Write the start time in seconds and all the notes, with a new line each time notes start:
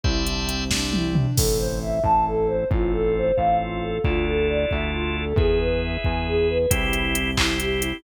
0.04 C2 E4 C5 D5 E5 G5, kick
0.27 D4, closed hi-hat
0.46 C4, closed hi-hat
0.71 D4 C5 D5 E5 G5, kick, snare
0.93 E4, high tom
1.15 D4, mid tom
1.37 A1 C4 E4 A4, kick, crash
1.58 C5
1.82 E5
2.04 A1 C4 E4 A4 A5, kick
2.26 A4
2.48 C5
2.71 A1 C4 F4 A4, kick
2.93 A4
3.17 C5
3.37 A1 C4 F4 A4 F5, kick
3.60 F4
3.81 A4
4.03 D2 D4 E4 F4 A4, kick
4.27 A4
4.50 D5
4.71 D2 E5, kick
4.93 F4
5.15 A4
5.36 E2 E4 G#4 B4, kick
5.60 B4
5.82 E5
6.04 E2 G#5, kick
6.27 G#4
6.49 B4
6.70 C2 C4 E4 G4, kick, closed hi-hat
6.93 E4, closed hi-hat
7.14 C4, closed hi-hat
7.37 C4 E4 G4, kick, clap
7.60 G4, closed hi-hat
7.80 E4, closed hi-hat